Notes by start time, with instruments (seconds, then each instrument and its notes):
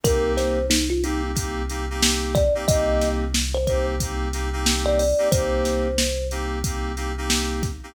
0.03 synth bass 2 C2, electric piano 2 A#3 C4 D#4 G4, kalimba A#4, kick, closed hi-hat
0.37 kalimba C5, snare, closed hi-hat
0.70 kalimba D#4, snare
0.90 kalimba F4
1.04 electric piano 2 A#3 C4 D#4 G4, kalimba D#4, closed hi-hat
1.35 electric piano 2 A#3 C4 D#4 G4, kick, closed hi-hat
1.70 electric piano 2 A#3 C4 D#4 G4, closed hi-hat
1.90 electric piano 2 A#3 C4 D#4 G4
2.02 snare
2.35 kalimba D5, kick, snare, closed hi-hat
2.55 electric piano 2 A#3 C4 D#4 G4
2.68 synth bass 2 C2, electric piano 2 A#3 C4 D#4 G4, kalimba D#5, kick, closed hi-hat
3.01 snare, closed hi-hat
3.34 snare
3.54 kalimba C5
3.67 electric piano 2 A#3 C4 D#4 G4, kalimba C5, kick, closed hi-hat
4.00 electric piano 2 A#3 C4 D#4 G4, kick, closed hi-hat
4.33 electric piano 2 A#3 C4 D#4 G4, snare, closed hi-hat
4.53 electric piano 2 A#3 C4 D#4 G4
4.66 snare
4.86 kalimba D5
4.99 kalimba D5, open hi-hat
5.18 electric piano 2 A#3 C4 D#4 G4
5.32 synth bass 2 C2, electric piano 2 A#3 C4 D#4 G4, kalimba C5, kick, closed hi-hat
5.65 snare, closed hi-hat
5.98 snare
6.31 electric piano 2 A#3 C4 D#4 G4, closed hi-hat
6.64 electric piano 2 A#3 C4 D#4 G4, kick, closed hi-hat
6.97 electric piano 2 A#3 C4 D#4 G4, closed hi-hat
7.18 electric piano 2 A#3 C4 D#4 G4
7.30 snare
7.63 kick, snare, closed hi-hat
7.83 electric piano 2 A#3 C4 D#4 G4